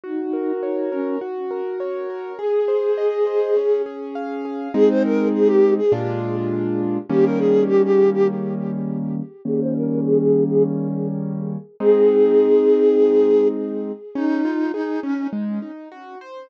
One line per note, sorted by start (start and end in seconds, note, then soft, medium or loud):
0.04 0.53 D#4 loud
0.04 1.15 F#4 medium
0.33 0.92 A#4 soft
0.63 0.90 D#4 medium
0.63 1.19 C#5 medium
0.92 1.18 C#4 loud
0.92 1.20 A#4 medium
1.21 2.33 F#4 medium
1.51 2.09 A#4 medium
1.80 2.36 C#5 medium
2.10 2.38 A#4 medium
2.39 3.51 G#4 medium
2.39 3.82 G#4 medium
2.68 3.26 C5 medium
2.98 3.53 D#5 medium
3.27 3.55 C5 medium
3.56 4.68 C#4 medium
3.86 4.45 G#4 medium
4.15 4.71 F5 medium
4.45 4.73 G#4 medium
4.74 5.80 G#3 medium
4.74 5.80 C4 medium
4.74 5.80 D#4 medium
4.74 4.89 G#4 loud
4.89 5.03 C5 loud
5.04 5.28 A#4 loud
5.34 5.48 G#4 loud
5.47 5.74 G4 loud
5.78 5.92 G#4 loud
5.92 6.98 A#2 medium
5.92 6.98 G#3 medium
5.92 6.98 D4 medium
5.92 6.98 F4 medium
7.10 9.21 D#3 medium
7.10 9.21 G3 medium
7.10 9.21 A#3 medium
7.10 9.21 C#4 medium
7.10 7.25 G4 medium
7.25 7.39 A#4 medium
7.39 7.63 G#4 loud
7.68 7.82 G4 loud
7.84 8.10 G4 loud
8.13 8.27 G4 loud
9.45 11.57 D#3 medium
9.45 11.57 G3 medium
9.45 11.57 A#3 medium
9.45 11.57 C#4 medium
9.45 9.60 G#4 loud
9.60 9.74 C5 loud
9.75 10.00 A#4 medium
10.04 10.18 G#4 loud
10.19 10.44 G#4 medium
10.49 10.63 G#4 medium
11.80 13.92 G#3 medium
11.80 13.92 C4 medium
11.80 13.92 D#4 medium
11.80 13.48 G#4 loud
14.15 14.42 C#4 medium
14.15 14.72 D#4 loud
14.45 14.71 F4 medium
14.73 15.00 D#4 loud
14.73 15.00 G#4 medium
15.03 15.27 C#4 loud
15.03 15.30 C#4 medium
15.33 15.59 G#3 medium
15.62 15.89 D#4 medium
15.92 16.18 F#4 medium
16.21 16.48 C5 medium